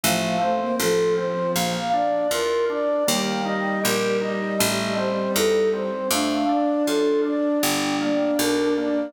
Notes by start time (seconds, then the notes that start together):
0.03 A1 F3 A3 F5
0.40 A3 C4 C5
0.60 A#3
0.79 A1 F3 F4 A4
1.17 C4 C5
1.55 A#1 A#3 F5
1.93 D4 D5
2.31 E2 F4 A#4
2.69 D4 D5
3.07 D#2 G3 A#3 G5
3.45 D#4 D#5
3.83 A#1 G4 A#4
4.21 D#4 D#5
4.59 A1 A3 D#5
4.97 C4 C5
5.35 E2 D#4 A4
5.73 C4 C5
6.11 F2 A3 D4 F5
6.49 D4 D5
6.86 F#2 F4 A4
7.25 D4 D5
7.62 G1 G3 G5
8.00 A#3 D5
8.38 B1 D4 A#4
8.77 A#3 D5